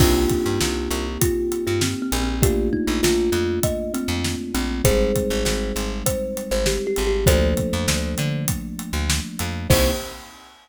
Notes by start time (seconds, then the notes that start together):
0.00 C2 A#3 C4 D4 D#4 F4 G4, kick, crash
0.29 kick, closed hi-hat
0.46 G2
0.61 C2, snare
0.91 C2, closed hi-hat
1.21 F4, kick, closed hi-hat
1.52 closed hi-hat
1.67 G2 F4
1.81 C4, snare
2.02 C4
2.12 A#1, closed hi-hat
2.22 C4
2.42 A3 A#3 D4 F4 G4, kick, closed hi-hat
2.73 D#4, kick
2.87 A#1 D#4
3.03 A#1 F4, snare, closed hi-hat
3.32 F2, closed hi-hat
3.63 D#5, kick, closed hi-hat
3.94 C4, closed hi-hat
4.08 F2
4.24 snare
4.54 A#1 C4, closed hi-hat
4.84 G#1 G3 G#3 C4 D#4 G#4 C5, kick, closed hi-hat
5.16 kick, closed hi-hat
5.30 G#1
5.45 G#1, snare
5.76 G#1, closed hi-hat
6.06 C5, kick, closed hi-hat
6.37 closed hi-hat
6.51 G#1 C5
6.66 G4, snare
6.87 G4
6.96 G#1, closed hi-hat
7.07 G4
7.26 D2 F3 A3 A#3 D4 A4 C5, kick, closed hi-hat
7.57 kick, closed hi-hat
7.73 F2
7.88 D2, snare
8.18 D3, closed hi-hat
8.48 kick, closed hi-hat
8.79 closed hi-hat
8.93 D2
9.10 snare
9.39 F2, closed hi-hat
9.70 C2 A#3 C4 D#4 G4 C5, kick, crash